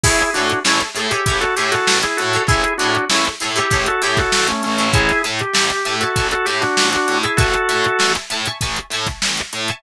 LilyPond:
<<
  \new Staff \with { instrumentName = "Drawbar Organ" } { \time 4/4 \key a \mixolydian \tempo 4 = 98 <e' gis'>8 <d' fis'>8 <cis' e'>16 r8 g'8 <fis' a'>16 g'16 <fis' a'>8 <e' gis'>16 <fis' a'>8 | <e' gis'>8 <d' fis'>8 <cis' e'>16 r8 g'8 <fis' a'>16 g'16 <fis' a'>8 <a cis'>16 <a cis'>8 | <e' gis'>8 r16 g'4 <fis' a'>8 <fis' a'>16 g'16 <d' fis'>8 <d' fis'>8 <e' gis'>16 | <fis' a'>4. r2 r8 | }
  \new Staff \with { instrumentName = "Acoustic Guitar (steel)" } { \time 4/4 \key a \mixolydian <e' gis' a' cis''>8 <e' gis' a' cis''>8 <e' gis' a' cis''>8 <e' gis' a' cis''>16 <e' gis' a' cis''>16 <e' gis' a' cis''>8 <e' gis' a' cis''>4~ <e' gis' a' cis''>16 <e' gis' a' cis''>16 | <e' gis' a' cis''>8 <e' gis' a' cis''>8 <e' gis' a' cis''>8 <e' gis' a' cis''>16 <e' gis' a' cis''>16 <e' gis' a' cis''>8 <e' gis' a' cis''>4~ <e' gis' a' cis''>16 <e' gis' a' cis''>16 | <e'' gis'' a'' cis'''>8 <e'' gis'' a'' cis'''>8 <e'' gis'' a'' cis'''>8 <e'' gis'' a'' cis'''>16 <e'' gis'' a'' cis'''>16 <e'' gis'' a'' cis'''>8 <e'' gis'' a'' cis'''>4~ <e'' gis'' a'' cis'''>16 <e'' gis'' a'' cis'''>16 | <e'' gis'' a'' cis'''>8 <e'' gis'' a'' cis'''>8 <e'' gis'' a'' cis'''>8 <e'' gis'' a'' cis'''>16 <e'' gis'' a'' cis'''>16 <e'' gis'' a'' cis'''>8 <e'' gis'' a'' cis'''>4~ <e'' gis'' a'' cis'''>16 <e'' gis'' a'' cis'''>16 | }
  \new Staff \with { instrumentName = "Electric Bass (finger)" } { \clef bass \time 4/4 \key a \mixolydian a,,8 a,8 a,,8 a,8 a,,8 a,8 a,,8 a,8 | a,,8 a,8 a,,8 a,8 a,,8 a,8 a,,8 a,,8~ | a,,8 a,8 a,,8 a,8 a,,8 a,8 a,,8 a,8 | a,,8 a,8 a,,8 a,8 a,,8 a,8 a,,8 a,8 | }
  \new DrumStaff \with { instrumentName = "Drums" } \drummode { \time 4/4 <cymc bd>16 hh16 hh16 hh16 sn16 hh16 hh16 hh16 <hh bd>16 <hh sn>16 hh16 <hh sn>16 sn16 hh16 hh16 hh16 | <hh bd>16 hh16 hh16 hh16 sn16 hh16 hh16 hh16 <hh bd>16 hh16 <hh sn>16 <hh bd sn>16 sn16 hh16 hh16 hh16 | <hh bd>16 <hh sn>16 hh16 hh16 sn16 hh16 hh16 hh16 <hh bd>16 hh16 hh16 <hh sn>16 sn16 <hh sn>16 hh16 hh16 | <hh bd>16 hh16 hh16 hh16 sn16 hh16 hh16 hh16 <hh bd>16 hh16 hh16 <hh bd sn>16 sn16 hh16 hh16 hh16 | }
>>